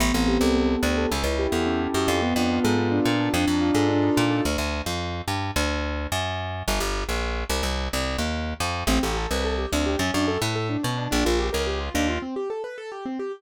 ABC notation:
X:1
M:2/2
L:1/8
Q:1/2=108
K:Aphr
V:1 name="Acoustic Grand Piano"
=B, C G A B, C G A | ^C E G A C E G A | =B, D F A B, D F A | D _E F A D E F A |
[K:Dphr] z8 | z8 | z8 | z8 |
[K:Aphr] C G A =B A G C G | ^C D A =B A D C D | D F G B G F D F | C G A =B A G C G |]
V:2 name="Electric Bass (finger)" clef=bass
A,,, A,,,2 C,,3 D,,2 | ^C,, C,,2 E,,3 ^F,, =F,,- | F,, F,,2 ^G,,3 B,,2 | F,, F,,2 ^G,,3 B,,2 |
[K:Dphr] D,, D,,2 F,,3 G,,2 | D,,4 ^F,,4 | G,,, G,,,2 B,,,3 C,, C,,- | C,, C,,2 E,,3 F,,2 |
[K:Aphr] A,,, A,,,2 C,,3 D,,2 | ^F,, F,,2 A,,3 =B,,2 | B,,, B,,,2 ^C,,3 _E,,2 | z8 |]